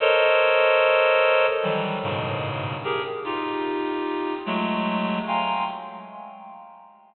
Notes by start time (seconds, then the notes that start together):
0.00 A4 A#4 C5 C#5 D#5
1.62 D#3 E3 F#3 G3
2.03 G2 G#2 A2 B2 C#3
2.84 G4 G#4 A#4
3.24 D#4 F4 G4
4.46 F#3 G#3 A3
5.27 F5 G5 G#5 A#5 C6